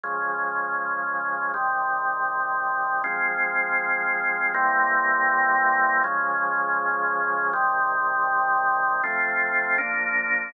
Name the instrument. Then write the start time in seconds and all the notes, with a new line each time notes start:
drawbar organ
0.04 C#3 F3 G#3
1.54 C3 D#3 G3
3.04 F3 G#3 C4
4.54 C3 E3 G3 A#3
6.04 C#3 F3 G#3
7.53 C3 D#3 G3
9.04 F3 A3 C4
9.78 F3 A#3 D4